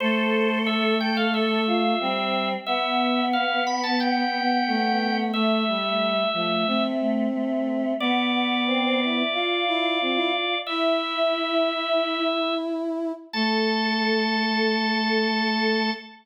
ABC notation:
X:1
M:4/4
L:1/16
Q:1/4=90
K:Am
V:1 name="Drawbar Organ"
c4 e2 g f e8 | e4 f2 b a g8 | e10 z6 | d16 |
e12 z4 | a16 |]
V:2 name="Choir Aahs"
A6 A2 A2 F2 C4 | B,16 | A,6 A,2 A,2 A,2 A,4 | B,2 B,2 C C E E F8 |
E10 z6 | A16 |]
V:3 name="Brass Section"
A,12 G,4 | B,12 A,4 | A,2 G,4 F,2 C8 | B,8 F2 E2 C E z2 |
E16 | A,16 |]